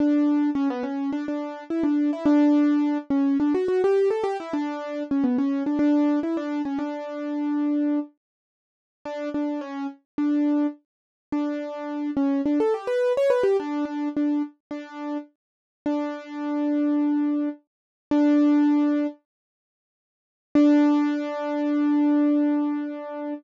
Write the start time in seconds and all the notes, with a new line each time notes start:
0.00 D4
0.55 C#4
0.70 B3
0.83 C#4
1.13 D4
1.28 D4
1.70 E4
1.83 D4
2.13 E4
2.26 D4
3.10 C#4
3.40 D4
3.54 F#4
3.68 F#4
3.84 G4
4.10 A4
4.24 G4
4.40 E4
4.53 D4
5.11 C#4
5.24 B3
5.38 C#4
5.66 D4
5.79 D4
6.23 E4
6.37 D4
6.65 C#4
6.79 D4
9.05 D4
9.34 D4
9.61 C#4
10.18 D4
11.32 D4
12.17 C#4
12.46 D4
12.60 A4
12.74 G4
12.87 B4
13.17 C#5
13.30 B4
13.43 G4
13.60 D4
13.85 D4
14.17 D4
14.71 D4
15.86 D4
18.11 D4
20.55 D4